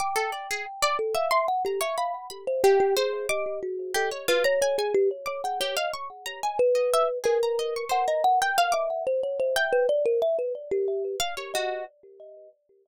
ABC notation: X:1
M:6/8
L:1/16
Q:3/8=61
K:none
V:1 name="Kalimba"
g6 A f e ^f G e | f z2 c G G ^G2 ^d2 ^F2 | A z B ^c c ^G =G z c ^f c ^d | z4 B4 ^A4 |
^f ^d f z2 e2 c ^c =c e B | d ^A e B z G3 z2 ^d2 |]
V:2 name="Orchestral Harp"
d' A d ^G z d z e c' z ^a ^c | b2 b z G2 c2 d'2 z2 | G ^c F ^a ^g g z2 d' =g G f | ^c' z ^a ^g z ^d e z ^G a d c' |
c ^a z g f d' z4 g2 | z8 f ^c ^F2 |]